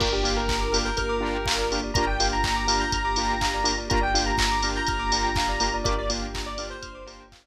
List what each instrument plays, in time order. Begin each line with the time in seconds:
0.00 synth bass 2 G1, string ensemble 1 A#3 D4 F4 G4, lead 2 (sawtooth) A#3 D4 F4 G4, tubular bells A#4, lead 1 (square) A#4, kick, crash
0.12 lead 1 (square) G4, tubular bells D5
0.23 lead 2 (sawtooth) A#3 D4 F4 G4, tubular bells F5, open hi-hat
0.37 lead 1 (square) A#4, tubular bells G5
0.48 tubular bells A#5, kick, clap
0.61 tubular bells D6
0.72 lead 2 (sawtooth) A#3 D4 F4 G4, tubular bells F6, open hi-hat
0.85 lead 1 (square) A#4, tubular bells G6
0.97 synth bass 2 G1, lead 1 (square) A#4, tubular bells F6, kick, closed hi-hat
1.09 tubular bells D6
1.20 lead 2 (sawtooth) A#3 D4 F4 G4, tubular bells A#5
1.35 tubular bells G5
1.46 tubular bells F5, kick, clap
1.58 tubular bells D5
1.71 lead 2 (sawtooth) A#3 D4 F4 G4, tubular bells A#4, open hi-hat
1.84 tubular bells D5
1.94 synth bass 2 G1, string ensemble 1 A#3 D4 F4 G4, lead 2 (sawtooth) A#3 D4 F4 G4, tubular bells A#4, lead 1 (square) A#5, kick, closed hi-hat
2.07 tubular bells D5, lead 1 (square) G5
2.20 lead 2 (sawtooth) A#3 D4 F4 G4, tubular bells F5, open hi-hat
2.32 tubular bells G5, lead 1 (square) A#5
2.44 tubular bells A#5, kick, clap
2.56 tubular bells D6
2.67 lead 2 (sawtooth) A#3 D4 F4 G4, tubular bells F6, open hi-hat
2.79 lead 1 (square) A#5, tubular bells G6
2.92 synth bass 2 G1, lead 1 (square) A#5, tubular bells F6, kick, closed hi-hat
3.05 tubular bells D6
3.16 lead 2 (sawtooth) A#3 D4 F4 G4, tubular bells A#5, open hi-hat
3.29 tubular bells G5
3.41 tubular bells F5, kick, clap
3.54 tubular bells D5
3.64 lead 2 (sawtooth) A#3 D4 F4 G4, tubular bells A#4, open hi-hat
3.78 tubular bells D5
3.90 synth bass 2 G1, lead 2 (sawtooth) A#3 D4 F4 G4, string ensemble 1 A#3 D4 F4 G4, tubular bells A#4, lead 1 (square) A#5, kick, closed hi-hat
4.01 tubular bells D5, lead 1 (square) G5
4.14 lead 2 (sawtooth) A#3 D4 F4 G4, tubular bells F5, open hi-hat
4.26 tubular bells G5, lead 1 (square) A#5
4.38 tubular bells A#5, kick, clap
4.51 tubular bells D6
4.62 lead 2 (sawtooth) A#3 D4 F4 G4, tubular bells F6, open hi-hat
4.76 lead 1 (square) A#5, tubular bells G6
4.87 synth bass 2 G1, lead 1 (square) A#5, tubular bells F6, kick, closed hi-hat
4.99 tubular bells D6
5.12 lead 2 (sawtooth) A#3 D4 F4 G4, tubular bells A#5, open hi-hat
5.24 tubular bells G5
5.36 tubular bells F5, kick, clap
5.49 tubular bells D5
5.60 lead 2 (sawtooth) A#3 D4 F4 G4, tubular bells A#4, open hi-hat
5.74 tubular bells D5
5.84 synth bass 2 G1, lead 2 (sawtooth) A#3 D4 F4 G4, string ensemble 1 A#3 D4 F4 G4, tubular bells A#4, lead 1 (square) D5, kick, closed hi-hat
5.98 lead 1 (square) D5, tubular bells D5
6.09 lead 2 (sawtooth) A#3 D4 F4 G4, tubular bells F5, open hi-hat
6.22 tubular bells G5
6.34 tubular bells A#5, kick, clap
6.46 lead 1 (square) D5, tubular bells D6
6.58 lead 2 (sawtooth) A#3 D4 F4 G4, tubular bells F6, open hi-hat
6.70 lead 1 (square) C5, tubular bells G6
6.82 synth bass 2 G1, tubular bells F6, kick, closed hi-hat
6.95 tubular bells D6
7.06 lead 2 (sawtooth) A#3 D4 F4 G4, tubular bells A#5, open hi-hat
7.20 tubular bells G5
7.32 tubular bells F5, kick, clap
7.44 tubular bells D5